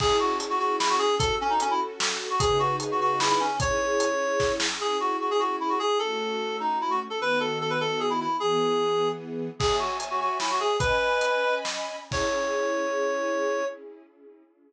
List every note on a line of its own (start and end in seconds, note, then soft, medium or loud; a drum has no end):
0.00 1.07 C#4 loud
0.00 1.07 E4 medium
0.00 1.07 G#4 medium
0.00 0.17 G#4 loud
0.00 kick loud
0.00 crash loud
0.20 0.38 F#4 loud
0.40 closed hi-hat loud
0.50 0.59 F#4 loud
0.59 0.76 F#4 loud
0.79 0.89 E4 loud
0.79 snare loud
0.90 0.99 F#4 loud
0.99 1.15 G#4 loud
1.19 2.29 C#4 medium
1.19 2.29 F#4 medium
1.19 1.35 A4 loud
1.19 2.29 A4 medium
1.19 kick loud
1.19 closed hi-hat loud
1.41 1.50 C#4 loud
1.50 1.59 D#4 loud
1.60 1.70 C#4 loud
1.60 closed hi-hat loud
1.71 1.80 E4 loud
2.00 snare loud
2.30 2.40 F#4 loud
2.39 3.48 C#3 medium
2.39 3.48 D#4 medium
2.39 2.58 G#4 loud
2.39 3.48 G#4 medium
2.39 3.48 B4 medium
2.39 kick loud
2.39 closed hi-hat loud
2.59 2.76 F#4 loud
2.80 closed hi-hat loud
2.91 3.00 F#4 medium
3.00 3.19 F#4 loud
3.20 3.29 E4 loud
3.20 snare loud
3.30 3.40 E4 loud
3.40 3.56 C#4 loud
3.60 4.68 C#4 medium
3.60 4.68 E4 medium
3.60 4.68 G#4 loud
3.60 4.52 C#5 loud
3.60 kick loud
3.60 closed hi-hat loud
4.00 closed hi-hat loud
4.40 kick loud
4.40 snare medium
4.60 snare loud
4.80 5.88 C#4 medium
4.80 5.88 E4 medium
4.80 5.88 G#4 medium
4.80 4.97 G#4 loud
5.00 5.17 F#4 loud
5.21 5.30 F#4 medium
5.31 5.40 G#4 loud
5.40 5.56 F#4 medium
5.60 5.70 E4 medium
5.69 5.79 F#4 medium
5.79 5.98 G#4 loud
5.99 7.08 A3 medium
5.99 7.08 C#4 medium
5.99 7.08 F#4 medium
5.99 6.57 A4 medium
6.60 6.79 D#4 medium
6.81 6.91 E4 medium
6.90 7.00 F#4 loud
7.10 7.19 A4 medium
7.20 8.28 D#3 medium
7.20 8.28 B3 medium
7.20 8.28 F#4 medium
7.20 7.39 B4 loud
7.40 7.58 A4 medium
7.61 7.70 A4 medium
7.70 7.79 B4 medium
7.80 8.00 A4 loud
8.00 8.09 G#4 medium
8.10 8.19 E4 loud
8.20 8.37 E4 loud
8.40 9.49 E3 medium
8.40 9.49 B3 medium
8.40 9.08 G#4 loud
8.40 9.49 G#4 medium
9.59 9.76 G#4 loud
9.59 10.69 C#5 medium
9.59 10.69 E5 medium
9.59 10.69 G#5 medium
9.59 kick loud
9.59 crash loud
9.79 9.97 F#4 medium
10.00 closed hi-hat loud
10.11 10.20 F#4 medium
10.20 10.38 F#4 medium
10.40 10.49 E4 medium
10.40 snare loud
10.51 10.60 F#4 loud
10.60 10.77 G#4 loud
10.79 11.96 C#4 medium
10.79 11.55 B4 loud
10.79 11.96 D#5 medium
10.79 11.96 G#5 medium
10.79 11.96 B5 medium
10.79 kick loud
10.79 closed hi-hat loud
11.21 closed hi-hat loud
11.65 snare loud
12.10 13.63 C#4 loud
12.10 13.63 E4 medium
12.10 13.63 G#4 medium
12.10 13.65 C#5 loud
12.10 kick loud
12.10 crash loud